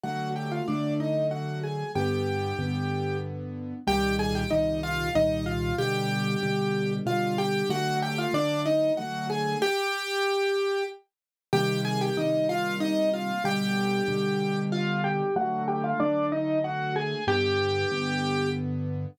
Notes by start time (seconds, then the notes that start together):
0.03 D3 F#3 A3 F#4 F#5
0.36 G4 G5
0.52 F4 F5
0.68 D3 F#3 A3 D4 D5
1.00 D#4 D#5
1.31 F#4 F#5
1.63 G#4 G#5
1.95 G2 D3 B3 G4 G5
2.59 G2 D3 B3
3.87 C2 A#2 D#3 G3 G4 G5
4.19 G#4 G#5
4.35 G4 G5
4.50 C2 A#2 D#3 G3 D#4 D#5
4.83 F4 F5
5.15 C2 A#2 D#3 G3 D#4 D#5
5.46 F4 F5
5.78 B2 D3 G3 G4 G5
6.43 B2 D3 G3
7.06 B2 D3 G3 F4 F5
7.38 G4 G5
7.69 D3 F#3 A3 F#4 F#5
8.02 G4 G5
8.18 F4 F5
8.33 D3 F#3 A3 D4 D5
8.66 D#4 D#5
8.97 D3 F#3 A3 F#4 F#5
9.30 G#4 G#5
9.62 G4 G5
11.53 C3 D#3 G3 A#3 G4 G5
11.85 G#4 G#5
12.01 G4 G5
12.17 C3 D#3 G3 A#3 D#4 D#5
12.49 F4 F5
12.80 D#4 D#5
13.13 F4 F5
13.44 B2 D3 G3 G4 G5
14.08 B2 D3 G3
14.72 F4 F5
15.04 G4 G5
15.36 D3 F#3 A3 F#4 F#5
15.68 G4 G5
15.84 F4 F5
16.00 D3 F#3 A3 D4 D5
16.32 D#4 D#5
16.64 F#4 F#5
16.96 G#4 G#5
17.27 G2 D3 B3 G4 G5
17.91 G2 D3 B3